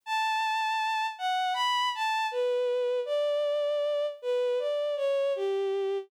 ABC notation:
X:1
M:4/4
L:1/8
Q:1/4=79
K:D
V:1 name="Violin"
a3 f b a B2 | d3 B d c G2 |]